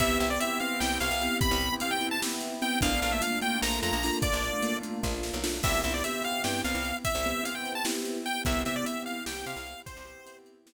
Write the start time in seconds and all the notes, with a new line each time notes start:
0.00 C2 B3 C4 E4 G4 E5, kick, closed hi-hat
0.20 C2 E5, closed hi-hat
0.30 B3 C4 E4 G4 D5
0.40 B3 C4 E4 G4 E5, closed hi-hat
0.60 B3 C4 E4 G4 F5, closed hi-hat
0.80 C2 B3 C4 E4 G4 G5, snare
1.00 C2 F5, closed hi-hat
1.11 C2
1.21 B3 C4 E4 G4, closed hi-hat
1.41 B5, kick, closed hi-hat
1.51 C2
1.60 closed hi-hat
1.73 B3 C4 E4 G4
1.80 B3 C4 E4 G4 F5, closed hi-hat
1.91 G5
2.01 B3 C4 E4 G4, closed hi-hat
2.11 A5
2.22 B3 C4 E4 G4, snare
2.41 closed hi-hat
2.62 B3 C4 E4 G4 G5, closed hi-hat
2.81 A#1 A3 A#3 D4 F4 F5, kick, closed hi-hat
3.02 A#1 F5, closed hi-hat
3.12 A3 A#3 D4 F4 E5
3.21 A3 A#3 D4 F4 F5, closed hi-hat
3.41 A3 A#3 D4 F4 G5, closed hi-hat
3.61 A#1 A3 A#3 D4 F4 A#5, snare
3.83 F2 A#5, closed hi-hat
3.93 A#1
4.03 A3 A#3 D4 F4, open hi-hat
4.22 D5, kick, closed hi-hat
4.33 A#1
4.44 closed hi-hat
4.53 A3 A#3 D4 F4
4.63 A3 A#3 D4 F4, closed hi-hat
4.81 A3 A#3 D4 F4, closed hi-hat
5.03 A#1 A3 A#3 D4 F4, kick, snare
5.23 snare
5.34 B1
5.43 A3 A#3 D4 F4, snare
5.63 C2 B3 C4 E4 G4 E5, kick, crash
5.83 C2 B3 C4 E4 G4 E5, closed hi-hat
5.94 D5
6.04 B3 C4 E4 G4 E5, closed hi-hat
6.23 F5, closed hi-hat
6.44 G2 B3 C4 E4 G4 G5, snare
6.64 C2 F5, closed hi-hat
6.74 C2
6.85 closed hi-hat
7.05 E5, kick, closed hi-hat
7.15 C2
7.25 B3 C4 E4 G4, closed hi-hat
7.43 B3 C4 E4 G4 F5, closed hi-hat
7.55 G5
7.65 closed hi-hat
7.75 A5
7.85 B3 C4 E4 G4, snare
8.05 closed hi-hat
8.26 G5, closed hi-hat
8.45 C2 B3 C4 E4 G4 E5, kick, closed hi-hat
8.65 C3 B3 C4 E4 G4 E5, closed hi-hat
8.76 D5
8.84 B3 C4 E4 G4 E5, closed hi-hat
9.06 F5, closed hi-hat
9.26 C2 B3 C4 E4 G4 G5, snare
9.46 C3 F5, closed hi-hat
9.56 C2
9.67 closed hi-hat
9.86 C5, kick, closed hi-hat
9.97 C2
10.05 B3 C4 E4 G4, closed hi-hat
10.26 B3 C4 E4 G4, closed hi-hat
10.46 closed hi-hat
10.66 B3 C4 E4 G4, snare